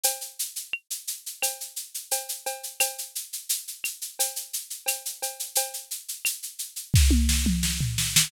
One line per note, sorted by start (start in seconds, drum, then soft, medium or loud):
0.04 cowbell medium
0.04 shaker loud
0.21 shaker medium
0.39 shaker medium
0.56 shaker medium
0.73 claves medium
0.91 shaker medium
1.07 shaker medium
1.26 shaker medium
1.43 cowbell medium
1.43 claves medium
1.43 shaker loud
1.61 shaker medium
1.76 shaker medium
1.94 shaker medium
2.11 cowbell medium
2.11 shaker loud
2.29 shaker medium
2.46 cowbell medium
2.46 shaker medium
2.63 shaker medium
2.80 cowbell medium
2.80 claves loud
2.80 shaker loud
2.98 shaker medium
3.15 shaker medium
3.33 shaker medium
3.49 shaker loud
3.68 shaker medium
3.84 claves medium
3.84 shaker medium
4.02 shaker medium
4.19 cowbell medium
4.19 shaker loud
4.36 shaker medium
4.53 shaker medium
4.70 shaker medium
4.86 cowbell medium
4.86 claves medium
4.86 shaker loud
5.05 shaker medium
5.22 cowbell medium
5.22 shaker medium
5.40 shaker medium
5.55 cowbell medium
5.55 shaker loud
5.74 shaker medium
5.91 shaker medium
6.08 shaker medium
6.25 claves medium
6.25 shaker loud
6.43 shaker medium
6.59 shaker medium
6.76 shaker medium
6.94 kick medium
6.94 snare medium
7.11 high tom medium
7.29 snare medium
7.46 mid tom medium
7.63 snare medium
7.81 floor tom medium
7.98 snare medium
8.16 snare loud